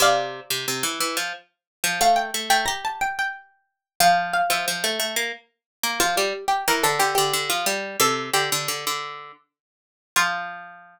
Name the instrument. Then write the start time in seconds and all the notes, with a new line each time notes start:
harpsichord
0.00 C3 D5 F5
0.50 C3
0.68 C3
0.83 E3
1.00 E3
1.17 F3
1.84 F3
2.01 A3 F5
2.16 G5
2.34 A3
2.50 A3 G5
2.66 G4 A#5
2.85 A5
3.01 G5
3.19 G5
4.00 F3 F5
4.33 F5
4.50 F3 E5
4.68 F3
4.84 A3
5.00 A3
5.16 A#3
5.83 A#3
6.00 F3 F4
6.17 G3 G4
6.48 G4
6.68 E3 A#4
6.83 D3 A4
6.99 D3 G4
7.15 D3 G4
7.33 D3
7.50 F3
7.66 G3
8.00 C3 A4
8.33 D3 G4
8.52 D3
8.68 D3
8.87 D3
10.16 F3 F4